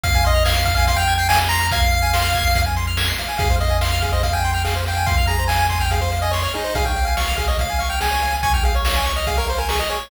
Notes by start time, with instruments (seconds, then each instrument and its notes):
0.03 synth bass 1 F2, lead 1 (square) F5, kick, closed hi-hat
0.14 lead 1 (square) G#5, kick, closed hi-hat
0.25 lead 1 (square) D#5 C6, closed hi-hat
0.34 lead 1 (square) F6, closed hi-hat
0.45 lead 1 (square) F5 G#6, snare
0.56 lead 1 (square) C7, closed hi-hat
0.65 lead 1 (square) F5, kick, closed hi-hat
0.75 lead 1 (square) F5 G#5, closed hi-hat
0.87 lead 1 (square) F5 C6, kick, closed hi-hat
0.96 lead 1 (square) G5 F6, closed hi-hat
1.08 lead 1 (square) G#6, snare, closed hi-hat
1.18 lead 1 (square) G5 C7, closed hi-hat
1.29 lead 1 (square) F5 G#5, snare
1.40 lead 1 (square) G#5, closed hi-hat
1.49 lead 1 (square) A#5 C6, closed hi-hat
1.61 lead 1 (square) F6, closed hi-hat
1.71 lead 1 (square) F5 G#6, kick, closed hi-hat
1.82 lead 1 (square) C7, closed hi-hat
1.92 lead 1 (square) F5, closed hi-hat
2.02 lead 1 (square) G#5, closed hi-hat
2.13 lead 1 (square) C6, snare
2.24 lead 1 (square) F6, closed hi-hat
2.34 lead 1 (square) G#6, kick, closed hi-hat
2.45 lead 1 (square) C7, closed hi-hat
2.55 lead 1 (square) F5, kick, closed hi-hat
2.66 lead 1 (square) G#5, closed hi-hat
2.76 lead 1 (square) C6, snare, closed hi-hat
2.87 lead 1 (square) F6, closed hi-hat
2.97 lead 1 (square) G#6, snare
3.08 lead 1 (square) C7, closed hi-hat
3.18 lead 1 (square) F5, closed hi-hat
3.29 lead 1 (square) G#5, closed hi-hat
3.38 synth bass 1 F2, lead 1 (square) G#4 F5, kick, closed hi-hat
3.50 lead 1 (square) C5, kick, closed hi-hat
3.60 lead 1 (square) D#5 F5, closed hi-hat
3.70 lead 1 (square) G#5, closed hi-hat
3.81 lead 1 (square) F5 C6, snare
3.92 lead 1 (square) F6, closed hi-hat
4.02 lead 1 (square) G#4 F5, kick, closed hi-hat
4.12 lead 1 (square) C5 D#5, closed hi-hat
4.23 lead 1 (square) F5, kick, closed hi-hat
4.33 lead 1 (square) G5 G#5, closed hi-hat
4.44 lead 1 (square) C6, snare, closed hi-hat
4.53 lead 1 (square) G5 F6, closed hi-hat
4.65 lead 1 (square) G#4 F5, snare
4.75 lead 1 (square) C5, closed hi-hat
4.86 lead 1 (square) F5 G5, closed hi-hat
4.97 lead 1 (square) G#5, closed hi-hat
5.06 lead 1 (square) F5 C6, kick, closed hi-hat
5.17 lead 1 (square) F6, kick, closed hi-hat
5.27 lead 1 (square) G#4 A#5, closed hi-hat
5.39 lead 1 (square) C5, closed hi-hat
5.48 lead 1 (square) F5 G#5, snare
5.60 lead 1 (square) G#5, closed hi-hat
5.69 lead 1 (square) G#5 C6, kick, closed hi-hat
5.80 lead 1 (square) G5 F6, closed hi-hat
5.91 lead 1 (square) G#4 F5, kick, closed hi-hat
6.00 lead 1 (square) C5 F5, closed hi-hat
6.12 lead 1 (square) F5, snare, closed hi-hat
6.22 lead 1 (square) D#5 G#5, closed hi-hat
6.31 lead 1 (square) C#5 C6, snare
6.43 lead 1 (square) C#5 F6, closed hi-hat
6.54 lead 1 (square) D#4 G#4, closed hi-hat
6.64 lead 1 (square) C5, closed hi-hat
6.75 synth bass 1 C#2, lead 1 (square) G#4 F5, kick, closed hi-hat
6.85 lead 1 (square) C#5 G5, kick, closed hi-hat
6.96 lead 1 (square) F5, closed hi-hat
7.05 lead 1 (square) F5 G#5, closed hi-hat
7.17 lead 1 (square) F5 C#6, snare
7.27 lead 1 (square) F6, closed hi-hat
7.36 lead 1 (square) G#4 F5, kick, closed hi-hat
7.47 lead 1 (square) C#5 D#5, closed hi-hat
7.59 lead 1 (square) F5, kick, closed hi-hat
7.69 lead 1 (square) G#5, closed hi-hat
7.79 lead 1 (square) F5 C#6, snare, closed hi-hat
7.90 lead 1 (square) G5 F6, closed hi-hat
8.00 lead 1 (square) G#4 G#5, snare
8.11 lead 1 (square) C#5, closed hi-hat
8.22 lead 1 (square) F5, closed hi-hat
8.32 lead 1 (square) G#5, closed hi-hat
8.43 lead 1 (square) G#5 C#6, kick, closed hi-hat
8.53 lead 1 (square) G5 F6, kick, closed hi-hat
8.63 lead 1 (square) G#4 F5, closed hi-hat
8.74 lead 1 (square) C#5, closed hi-hat
8.85 lead 1 (square) F5, snare
8.95 lead 1 (square) G#5, closed hi-hat
9.06 lead 1 (square) C#6, closed hi-hat
9.16 lead 1 (square) D#5 F6, closed hi-hat
9.27 lead 1 (square) G#4 F5, kick, closed hi-hat
9.37 lead 1 (square) A#4 C#5, closed hi-hat
9.48 lead 1 (square) C5 F5, snare, closed hi-hat
9.58 lead 1 (square) A#4 G#5, closed hi-hat
9.69 lead 1 (square) G#4 C#6, snare
9.79 lead 1 (square) D#5 F6, closed hi-hat
9.89 lead 1 (square) G#4 C#5, closed hi-hat
10.00 lead 1 (square) C#5, open hi-hat